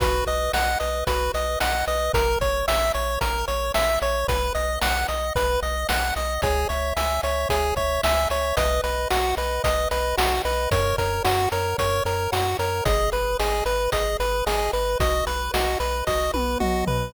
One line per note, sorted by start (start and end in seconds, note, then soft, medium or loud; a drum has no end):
0.00 0.23 B1 medium
0.00 0.24 F#4 medium
0.00 0.25 B4 medium
0.00 kick loud
0.00 closed hi-hat loud
0.27 0.49 B1 medium
0.27 0.51 B4 medium
0.27 0.52 D#5 medium
0.27 closed hi-hat medium
0.53 0.76 B1 medium
0.53 0.78 D#5 medium
0.53 0.79 F#5 medium
0.53 snare loud
0.80 1.04 B1 medium
0.80 1.04 B4 medium
0.80 1.04 D#5 medium
0.80 closed hi-hat medium
1.07 1.30 B1 medium
1.07 1.31 F#4 medium
1.07 1.32 B4 medium
1.07 kick medium
1.07 closed hi-hat loud
1.34 1.57 B1 medium
1.34 1.58 B4 medium
1.34 1.59 D#5 medium
1.34 closed hi-hat medium
1.60 1.84 B1 medium
1.60 1.85 D#5 medium
1.60 1.85 F#5 medium
1.60 snare loud
1.87 2.10 B1 medium
1.87 2.12 B4 medium
1.87 2.12 D#5 medium
1.87 closed hi-hat medium
2.14 2.36 A#1 medium
2.14 2.39 A#4 medium
2.14 2.38 A#4 medium
2.14 kick loud
2.14 closed hi-hat loud
2.41 2.63 A#1 medium
2.41 2.65 C#5 medium
2.41 2.66 C#5 medium
2.41 kick medium
2.41 closed hi-hat medium
2.68 2.91 A#1 medium
2.68 2.92 E5 medium
2.68 snare loud
2.94 3.18 A#1 medium
2.94 3.19 C#5 medium
2.94 closed hi-hat medium
3.21 3.44 A#1 medium
3.21 3.46 A#4 medium
3.21 kick medium
3.21 closed hi-hat loud
3.48 3.71 A#1 medium
3.48 3.72 C#5 medium
3.48 closed hi-hat medium
3.74 3.98 A#1 medium
3.74 3.99 E5 medium
3.74 snare loud
4.02 4.24 A#1 medium
4.02 4.26 C#5 medium
4.02 4.27 C#5 medium
4.02 closed hi-hat medium
4.28 4.51 B1 medium
4.28 4.53 B4 medium
4.28 kick loud
4.28 closed hi-hat loud
4.55 4.78 B1 medium
4.55 4.79 D#5 medium
4.55 closed hi-hat medium
4.81 5.05 B1 medium
4.81 5.06 F#5 medium
4.81 5.07 F#5 medium
4.81 snare loud
5.08 5.32 B1 medium
5.08 5.33 D#5 medium
5.08 closed hi-hat medium
5.35 5.58 B1 medium
5.35 5.60 B4 medium
5.35 kick medium
5.35 closed hi-hat medium
5.62 5.85 B1 medium
5.62 5.87 D#5 medium
5.62 closed hi-hat medium
5.89 6.12 B1 medium
5.89 6.13 F#5 medium
5.89 6.14 F#5 medium
5.89 snare loud
6.16 6.39 B1 medium
6.16 6.40 D#5 medium
6.16 6.41 D#5 medium
6.16 closed hi-hat medium
6.42 6.65 C#2 medium
6.42 6.68 G#4 medium
6.42 6.67 C#5 medium
6.42 kick loud
6.42 closed hi-hat loud
6.69 6.93 C#2 medium
6.69 6.94 C#5 medium
6.69 6.94 E5 medium
6.69 closed hi-hat medium
6.96 7.19 C#2 medium
6.96 7.21 E5 medium
6.96 7.21 G#5 medium
6.96 snare loud
7.23 7.46 C#2 medium
7.23 7.48 C#5 medium
7.23 7.47 E5 medium
7.23 closed hi-hat medium
7.49 7.73 C#2 medium
7.49 7.75 G#4 medium
7.49 7.74 C#5 medium
7.49 kick medium
7.49 closed hi-hat loud
7.76 7.99 C#2 medium
7.76 8.01 C#5 medium
7.76 8.01 E5 medium
7.76 kick medium
7.76 closed hi-hat medium
8.03 8.27 C#2 medium
8.03 8.29 E5 medium
8.03 8.28 G#5 medium
8.03 snare loud
8.30 8.53 C#2 medium
8.30 8.56 C#5 medium
8.30 8.54 E5 medium
8.30 closed hi-hat medium
8.57 8.80 B1 medium
8.57 8.81 B4 medium
8.57 8.81 D#5 medium
8.57 kick medium
8.57 closed hi-hat loud
8.84 9.07 B1 medium
8.84 9.08 B4 medium
8.84 9.08 D#5 medium
8.84 closed hi-hat medium
9.10 9.34 B1 medium
9.10 9.35 F#4 medium
9.10 9.35 F#5 medium
9.10 snare loud
9.37 9.60 B1 medium
9.37 9.62 B4 medium
9.37 9.62 D#5 medium
9.37 closed hi-hat medium
9.64 9.87 B1 medium
9.64 9.88 B4 medium
9.64 9.89 D#5 medium
9.64 kick medium
9.64 closed hi-hat loud
9.91 10.14 B1 medium
9.91 10.16 B4 medium
9.91 10.15 D#5 medium
9.91 closed hi-hat medium
10.17 10.41 B1 medium
10.17 10.42 F#4 medium
10.17 10.42 F#5 medium
10.17 snare loud
10.45 10.68 B1 medium
10.45 10.70 B4 medium
10.45 10.69 D#5 medium
10.45 closed hi-hat medium
10.71 10.94 F#2 medium
10.71 10.96 A#4 medium
10.71 10.96 C#5 medium
10.71 kick loud
10.71 closed hi-hat loud
10.98 11.21 F#2 medium
10.98 11.23 A#4 medium
10.98 11.22 C#5 medium
10.98 kick medium
10.98 closed hi-hat medium
11.24 11.48 F#2 medium
11.24 11.49 F#4 medium
11.24 11.49 F#5 medium
11.24 snare loud
11.52 11.75 F#2 medium
11.52 11.77 A#4 medium
11.52 11.76 C#5 medium
11.52 closed hi-hat medium
11.78 12.01 F#2 medium
11.78 12.03 A#4 medium
11.78 12.04 C#5 medium
11.78 kick medium
11.78 closed hi-hat medium
12.05 12.28 F#2 medium
12.05 12.31 A#4 medium
12.05 12.29 C#5 medium
12.05 closed hi-hat medium
12.32 12.55 F#2 medium
12.32 12.57 F#4 medium
12.32 12.56 F#5 medium
12.32 snare loud
12.59 12.82 F#2 medium
12.59 12.84 A#4 medium
12.59 12.83 C#5 medium
12.59 closed hi-hat medium
12.85 13.09 G#1 medium
12.85 13.10 G#4 medium
12.85 13.10 D#5 medium
12.85 kick loud
12.85 closed hi-hat loud
13.12 13.36 G#1 medium
13.12 13.36 B4 medium
13.12 13.37 B4 medium
13.12 closed hi-hat medium
13.39 13.62 G#1 medium
13.39 13.64 G#4 medium
13.39 13.63 D#5 medium
13.39 snare loud
13.65 13.88 G#1 medium
13.65 13.90 B4 medium
13.65 closed hi-hat medium
13.92 14.16 G#1 medium
13.92 14.17 G#4 medium
13.92 14.17 D#5 medium
13.92 kick medium
13.92 closed hi-hat loud
14.20 14.42 G#1 medium
14.20 14.44 B4 medium
14.20 14.45 B4 medium
14.20 closed hi-hat medium
14.46 14.69 G#1 medium
14.46 14.71 G#4 medium
14.46 14.70 D#5 medium
14.46 snare loud
14.73 14.96 G#1 medium
14.73 14.97 B4 medium
14.73 14.98 B4 medium
14.73 closed hi-hat medium
15.00 15.22 B1 medium
15.00 15.24 F#4 medium
15.00 15.25 D#5 medium
15.00 kick loud
15.00 closed hi-hat loud
15.27 15.50 B1 medium
15.27 15.51 B4 medium
15.27 15.52 B4 medium
15.27 closed hi-hat medium
15.54 15.77 B1 medium
15.54 15.78 F#4 medium
15.54 15.78 D#5 medium
15.54 snare loud
15.80 16.03 B1 medium
15.80 16.05 B4 medium
15.80 16.04 B4 medium
15.80 closed hi-hat medium
16.07 16.30 B1 medium
16.07 16.31 F#4 medium
16.07 16.32 D#5 medium
16.07 kick medium
16.07 snare medium
16.34 16.57 B1 medium
16.34 16.58 B4 medium
16.34 high tom medium
16.60 16.84 B1 medium
16.60 16.85 F#4 medium
16.60 16.85 D#5 medium
16.60 mid tom loud
16.87 17.10 B1 medium
16.87 17.12 B4 medium
16.87 floor tom loud